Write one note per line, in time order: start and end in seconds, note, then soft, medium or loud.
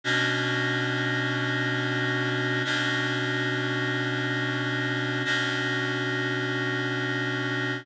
0.04 2.62 B2 loud
0.04 2.62 C#4 medium
0.04 2.62 D4 medium
0.04 2.62 F#4 medium
2.65 5.23 B2 medium
2.65 5.23 C#4 medium
2.65 5.23 D4 medium
2.65 5.23 F#4 medium
5.25 7.83 B2 medium
5.25 7.83 C#4 medium
5.25 7.83 D4 medium
5.25 7.83 F#4 medium